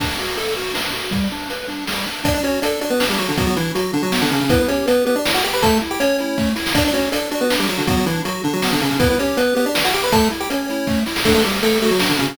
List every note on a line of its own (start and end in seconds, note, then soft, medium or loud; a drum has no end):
0.00 0.17 D4 medium
0.00 kick medium
0.00 crash medium
0.19 0.36 F#4 medium
0.19 closed hi-hat medium
0.37 0.54 A4 medium
0.37 closed hi-hat medium
0.56 0.73 F#4 medium
0.56 closed hi-hat medium
0.74 0.91 D4 medium
0.74 snare medium
0.93 1.10 F#4 medium
0.93 closed hi-hat medium
1.11 1.28 G3 medium
1.11 kick medium
1.11 closed hi-hat medium
1.32 1.49 D4 medium
1.32 closed hi-hat medium
1.50 1.67 B4 medium
1.50 closed hi-hat medium
1.68 1.85 D4 medium
1.68 closed hi-hat medium
1.87 2.05 G3 medium
1.87 snare medium
2.06 2.23 D4 medium
2.06 closed hi-hat medium
2.24 2.41 D4 medium
2.24 2.34 D4 medium
2.24 2.34 D5 loud
2.24 kick loud
2.24 closed hi-hat loud
2.34 2.43 D4 medium
2.34 2.43 D5 medium
2.43 2.60 C#4 medium
2.43 2.60 F#4 medium
2.43 2.60 C#5 medium
2.43 closed hi-hat medium
2.62 2.80 D4 medium
2.62 2.80 A4 medium
2.62 2.80 D5 medium
2.62 closed hi-hat loud
2.81 2.90 D4 medium
2.81 2.98 F#4 medium
2.81 2.90 D5 medium
2.81 closed hi-hat medium
2.90 3.05 B3 medium
2.90 3.05 B4 medium
3.00 3.18 D4 medium
3.00 snare loud
3.10 3.19 G3 medium
3.10 3.19 G4 medium
3.18 3.28 F#3 medium
3.18 3.35 F#4 medium
3.18 3.28 F#4 medium
3.18 closed hi-hat medium
3.28 3.37 D3 medium
3.28 3.37 D4 medium
3.38 3.46 F#3 medium
3.38 3.55 B3 medium
3.38 3.46 F#4 medium
3.38 kick loud
3.38 closed hi-hat medium
3.47 3.56 F#3 medium
3.47 3.56 F#4 medium
3.56 3.72 E3 medium
3.56 3.73 D4 medium
3.56 3.72 E4 medium
3.56 closed hi-hat medium
3.75 3.92 F#3 medium
3.75 3.92 F#4 medium
3.75 closed hi-hat medium
3.93 4.02 D3 medium
3.93 4.02 D4 medium
3.93 4.11 D4 medium
3.93 closed hi-hat medium
4.03 4.21 F#3 medium
4.03 4.21 F#4 medium
4.12 4.29 B3 medium
4.12 snare loud
4.22 4.30 D3 medium
4.22 4.30 D4 medium
4.31 4.40 C#3 medium
4.31 4.40 C#4 medium
4.31 4.48 D4 medium
4.31 closed hi-hat medium
4.41 4.50 C#3 medium
4.41 4.50 C#4 medium
4.49 4.58 B3 medium
4.49 4.67 E4 medium
4.49 4.58 B4 medium
4.49 kick loud
4.49 closed hi-hat loud
4.59 4.68 B3 medium
4.59 4.68 B4 medium
4.68 4.86 C#4 medium
4.68 4.86 G4 medium
4.68 4.86 C#5 medium
4.68 closed hi-hat medium
4.86 5.05 B3 medium
4.86 5.03 B4 medium
4.86 5.05 B4 medium
4.86 closed hi-hat loud
5.05 5.15 B3 medium
5.05 5.22 G4 medium
5.05 5.15 B4 medium
5.05 closed hi-hat medium
5.16 5.32 D4 medium
5.16 5.32 D5 medium
5.25 5.42 E4 medium
5.25 snare loud
5.34 5.43 F#4 medium
5.34 5.43 F#5 medium
5.44 5.61 G4 medium
5.44 5.53 G4 medium
5.44 5.53 G5 medium
5.44 closed hi-hat medium
5.53 5.62 B4 medium
5.53 5.62 B5 medium
5.62 5.80 A3 loud
5.62 5.78 A4 medium
5.62 5.78 A5 medium
5.62 kick loud
5.62 closed hi-hat loud
5.81 5.99 E4 medium
5.81 closed hi-hat medium
5.91 6.00 G4 medium
5.91 6.00 G5 medium
6.00 6.49 C#4 medium
6.00 6.49 C#5 medium
6.00 6.17 C#5 medium
6.00 closed hi-hat medium
6.18 6.37 E4 medium
6.18 closed hi-hat medium
6.38 6.54 A3 medium
6.38 kick medium
6.38 snare medium
6.56 6.73 E4 medium
6.56 snare medium
6.66 snare loud
6.74 6.91 D4 medium
6.74 6.84 D4 medium
6.74 6.84 D5 loud
6.74 kick loud
6.74 closed hi-hat loud
6.85 6.94 D4 medium
6.85 6.94 D5 medium
6.93 7.10 C#4 medium
6.93 7.10 F#4 medium
6.93 7.10 C#5 medium
6.93 closed hi-hat medium
7.11 7.30 D4 medium
7.11 7.28 A4 medium
7.11 7.30 D5 medium
7.11 closed hi-hat loud
7.31 7.41 D4 medium
7.31 7.48 F#4 medium
7.31 7.41 D5 medium
7.31 closed hi-hat medium
7.41 7.56 B3 medium
7.41 7.56 B4 medium
7.50 7.67 D4 medium
7.50 snare loud
7.59 7.68 G3 medium
7.59 7.68 G4 medium
7.68 7.78 F#3 medium
7.68 7.84 F#4 medium
7.68 7.78 F#4 medium
7.68 closed hi-hat medium
7.78 7.87 D3 medium
7.78 7.87 D4 medium
7.87 7.96 F#3 medium
7.87 8.05 B3 medium
7.87 7.96 F#4 medium
7.87 kick loud
7.87 closed hi-hat medium
7.97 8.06 F#3 medium
7.97 8.06 F#4 medium
8.06 8.22 E3 medium
8.06 8.23 D4 medium
8.06 8.22 E4 medium
8.06 closed hi-hat medium
8.25 8.42 F#3 medium
8.25 8.42 F#4 medium
8.25 closed hi-hat medium
8.44 8.53 D3 medium
8.44 8.61 D4 medium
8.44 8.53 D4 medium
8.44 closed hi-hat medium
8.53 8.71 F#3 medium
8.53 8.71 F#4 medium
8.62 8.80 B3 medium
8.62 snare loud
8.72 8.81 D3 medium
8.72 8.81 D4 medium
8.80 8.90 C#3 medium
8.80 8.90 C#4 medium
8.80 8.97 D4 medium
8.80 closed hi-hat medium
8.90 8.99 C#3 medium
8.90 8.99 C#4 medium
8.99 9.08 B3 medium
8.99 9.16 E4 medium
8.99 9.08 B4 medium
8.99 kick loud
8.99 closed hi-hat loud
9.10 9.19 B3 medium
9.10 9.19 B4 medium
9.19 9.37 C#4 medium
9.19 9.37 G4 medium
9.19 9.37 C#5 medium
9.19 closed hi-hat medium
9.37 9.54 B3 medium
9.37 9.54 B4 medium
9.37 9.55 B4 medium
9.37 closed hi-hat loud
9.55 9.65 B3 medium
9.55 9.72 G4 medium
9.55 9.65 B4 medium
9.55 closed hi-hat medium
9.66 9.83 D4 medium
9.66 9.83 D5 medium
9.74 9.91 E4 medium
9.74 snare loud
9.85 9.94 F#4 medium
9.85 9.94 F#5 medium
9.93 10.10 G4 medium
9.93 10.03 G4 medium
9.93 10.03 G5 medium
9.93 closed hi-hat medium
10.04 10.12 B4 medium
10.04 10.12 B5 medium
10.12 10.29 A3 loud
10.12 10.28 A4 medium
10.12 10.28 A5 medium
10.12 kick loud
10.12 closed hi-hat loud
10.30 10.47 E4 medium
10.30 closed hi-hat medium
10.40 10.49 G4 medium
10.40 10.49 G5 medium
10.50 11.00 C#4 medium
10.50 10.67 C#5 medium
10.50 11.00 C#5 medium
10.50 closed hi-hat medium
10.69 10.87 E4 medium
10.69 closed hi-hat medium
10.87 11.04 A3 medium
10.87 kick medium
10.87 snare medium
11.06 11.23 E4 medium
11.06 snare medium
11.16 snare loud
11.24 11.34 A3 medium
11.24 11.43 D4 medium
11.24 11.34 A4 medium
11.24 kick medium
11.24 crash loud
11.34 11.43 A3 medium
11.34 11.43 A4 medium
11.44 11.60 G3 medium
11.44 11.61 F#4 medium
11.44 11.60 G4 medium
11.44 closed hi-hat medium
11.63 11.78 A3 medium
11.63 11.78 A4 medium
11.63 11.80 A4 medium
11.63 closed hi-hat loud
11.82 11.91 A3 medium
11.82 11.99 F#4 medium
11.82 11.91 A4 medium
11.82 closed hi-hat medium
11.91 12.09 F#3 medium
11.91 12.09 F#4 medium
11.99 12.17 D4 medium
11.99 snare loud
12.09 12.18 D3 medium
12.09 12.18 D4 medium
12.19 12.27 C#3 medium
12.19 12.27 C#4 medium
12.19 12.36 F#4 medium
12.19 closed hi-hat medium
12.28 12.37 C#3 medium
12.28 12.37 C#4 medium